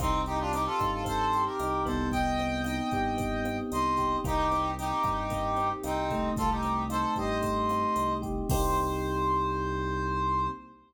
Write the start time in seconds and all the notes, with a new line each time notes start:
0.00 C2 C4 D#4, kick, cross-stick, closed hi-hat
0.26 D#4 G4, closed hi-hat
0.39 D4 F4
0.53 C4 D#4 G4, closed hi-hat
0.66 F4 A4
0.79 G2 D#4, kick, cross-stick, closed hi-hat
0.92 F4 A4
1.04 C4 A4 C5, kick, closed hi-hat
1.33 G4, closed hi-hat
1.45 G4 A#4
1.60 C2 D#4, cross-stick, closed hi-hat
1.85 C2 B3 A4 C5, kick, closed hi-hat
2.12 D#5 G5, kick, closed hi-hat
2.39 C4, closed hi-hat
2.64 D#4 D#5 G5, cross-stick, closed hi-hat
2.91 G2 G4, kick, closed hi-hat
3.17 B3, kick, closed hi-hat
3.45 C4, cross-stick, closed hi-hat
3.72 C2 D#4 C5 D#5, closed hi-hat
3.97 G4, kick, closed hi-hat
4.24 C2 A#3 D#4 G4, kick, cross-stick, closed hi-hat
4.51 C4, closed hi-hat
4.78 D#4 G4, closed hi-hat
5.04 G2 G4, kick, cross-stick, closed hi-hat
5.30 A#3, kick, closed hi-hat
5.57 C4, closed hi-hat
5.83 C2 C4 D#4, cross-stick, closed hi-hat
6.11 A3, kick, closed hi-hat
6.37 C2 F4 A4, kick, closed hi-hat
6.50 D#4 G4
6.63 C4, closed hi-hat
6.90 D#4 A4 C5, cross-stick, closed hi-hat
7.16 G2 G4 C5 D#5, kick, closed hi-hat
7.42 A3, kick, closed hi-hat
7.69 C4, cross-stick, closed hi-hat
7.96 C2 D#4, closed hi-hat
8.22 G4, kick, closed hi-hat
8.49 C2 A#3 C4 D#4 G4 C5, kick, crash